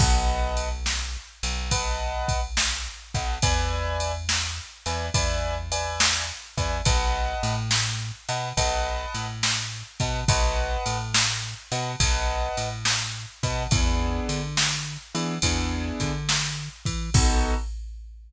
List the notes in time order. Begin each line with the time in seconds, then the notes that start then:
0.00 B1 B4 D#5 F#5 A5, kick, crash
0.57 ride
0.86 snare
1.43 B1, ride
1.71 B4 D#5 F#5 A5, kick, ride
2.28 kick, ride
2.57 snare
3.14 B1 B4 D#5 F#5 A5, kick, ride
3.42 E2 B4 D5 E5 G#5, kick, ride
4.00 ride
4.29 snare
4.86 E2 B4 D5 E5 G#5, ride
5.14 E2 B4 D5 E5 G#5, kick, ride
5.72 B4 D5 E5 G#5, ride
6.00 snare
6.58 E2 B4 D5 E5 G#5, kick, ride
6.85 B1 B4 D#5 F#5 A5, kick, ride
7.43 A2, ride
7.71 snare
8.29 B2 B4 D#5 F#5 A5, ride
8.57 B1 B4 D#5 F#5 A5, kick, ride
9.14 A2, ride
9.43 snare
10.00 B2 B4 D#5 F#5 A5, kick, ride
10.28 B1 B4 D#5 F#5 A5, kick, ride
10.86 A2, ride
11.14 snare
11.72 B2 B4 D#5 F#5 A5, ride
12.00 B1 B4 D#5 F#5 A5, kick, ride
12.57 A2, ride
12.85 snare
13.43 B2 B4 D#5 F#5 A5, kick, ride
13.71 E2 B3 D4 E4 G#4, kick, ride
14.29 D3, ride
14.57 snare
15.15 E3 B3 D4 E4 G#4, ride
15.42 E2 B3 D4 E4 G#4, kick, ride
16.00 D3, kick, ride
16.29 snare
16.85 E3, kick, ride
17.14 B1 B3 D#4 F#4 A4, kick, crash